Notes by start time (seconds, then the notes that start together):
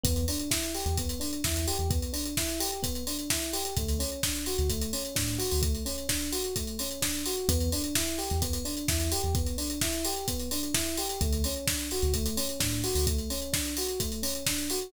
0.03 E2 B3, kick, closed hi-hat
0.16 closed hi-hat
0.28 D4, open hi-hat
0.40 closed hi-hat
0.51 E4, kick, snare
0.63 closed hi-hat
0.74 G4, open hi-hat
0.86 E2, closed hi-hat
0.97 B3, kick, closed hi-hat
1.09 closed hi-hat
1.20 D4, open hi-hat
1.33 closed hi-hat
1.44 E2 E4, kick, snare
1.56 closed hi-hat
1.67 G4, open hi-hat
1.79 E2, closed hi-hat
1.91 B3, kick, closed hi-hat
2.02 closed hi-hat
2.13 D4, open hi-hat
2.25 closed hi-hat
2.37 E4, kick, snare
2.49 closed hi-hat
2.60 G4, open hi-hat
2.72 closed hi-hat
2.83 B3, kick, closed hi-hat
2.95 closed hi-hat
3.07 D4, open hi-hat
3.19 closed hi-hat
3.30 E4, kick, snare
3.42 closed hi-hat
3.53 G4, open hi-hat
3.65 closed hi-hat
3.77 D2 A3, kick, closed hi-hat
3.88 closed hi-hat
3.99 C#4, open hi-hat
4.12 closed hi-hat
4.23 D4, kick, snare
4.35 closed hi-hat
4.46 F#4, open hi-hat
4.58 D2, closed hi-hat
4.69 A3, kick, closed hi-hat
4.81 closed hi-hat
4.93 C#4, open hi-hat
5.05 closed hi-hat
5.15 A2 D4, kick, snare
5.28 closed hi-hat
5.38 F#4, open hi-hat
5.51 D2, open hi-hat
5.62 A3, kick, closed hi-hat
5.75 closed hi-hat
5.85 C#4, open hi-hat
5.98 closed hi-hat
6.09 D4, kick, snare
6.21 closed hi-hat
6.32 F#4, open hi-hat
6.44 closed hi-hat
6.56 A3, kick, closed hi-hat
6.67 closed hi-hat
6.79 C#4, open hi-hat
6.91 closed hi-hat
7.02 D4, kick, snare
7.14 closed hi-hat
7.26 F#4, open hi-hat
7.37 closed hi-hat
7.49 E2 B3, kick, closed hi-hat
7.60 closed hi-hat
7.72 D4, open hi-hat
7.84 closed hi-hat
7.95 E4, kick, snare
8.07 closed hi-hat
8.18 G4, open hi-hat
8.30 E2, closed hi-hat
8.42 B3, kick, closed hi-hat
8.53 closed hi-hat
8.65 D4, open hi-hat
8.77 closed hi-hat
8.88 E2 E4, kick, snare
9.00 closed hi-hat
9.12 G4, open hi-hat
9.23 E2, closed hi-hat
9.35 B3, kick, closed hi-hat
9.47 closed hi-hat
9.58 D4, open hi-hat
9.70 closed hi-hat
9.81 E4, kick, snare
9.93 closed hi-hat
10.05 G4, open hi-hat
10.16 closed hi-hat
10.28 B3, kick, closed hi-hat
10.40 closed hi-hat
10.51 D4, open hi-hat
10.63 closed hi-hat
10.74 E4, kick, snare
10.86 closed hi-hat
10.97 G4, open hi-hat
11.09 closed hi-hat
11.21 D2 A3, kick, closed hi-hat
11.33 closed hi-hat
11.44 C#4, open hi-hat
11.56 closed hi-hat
11.67 D4, kick, snare
11.79 closed hi-hat
11.91 F#4, open hi-hat
12.02 D2, closed hi-hat
12.14 A3, kick, closed hi-hat
12.26 closed hi-hat
12.37 C#4, open hi-hat
12.49 closed hi-hat
12.60 A2 D4, kick, snare
12.72 closed hi-hat
12.84 F#4, open hi-hat
12.95 D2, open hi-hat
13.07 A3, kick, closed hi-hat
13.19 closed hi-hat
13.30 C#4, open hi-hat
13.42 closed hi-hat
13.53 D4, kick, snare
13.65 closed hi-hat
13.77 F#4, open hi-hat
13.88 closed hi-hat
14.00 A3, kick, closed hi-hat
14.12 closed hi-hat
14.22 C#4, open hi-hat
14.35 closed hi-hat
14.46 D4, kick, snare
14.58 closed hi-hat
14.70 F#4, open hi-hat
14.81 closed hi-hat